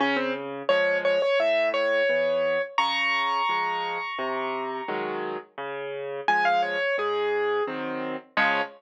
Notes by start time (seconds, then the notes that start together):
0.00 C#3 C#4
0.16 C4
0.69 F3 G#3 C#5
1.05 C#5
1.22 C#5
1.40 A2 E5
1.74 C#5
2.09 E3 B3
2.78 C#3 A#5 C#6
3.49 F3 G#3
4.18 C3
4.88 D#3 F#3 G#3
5.58 C#3
6.28 F3 G#3 G#5
6.45 F5
6.62 C#5
6.98 G#2 G#4
7.67 D#3 F#3 C4
8.37 C#3 F3 G#3 C#5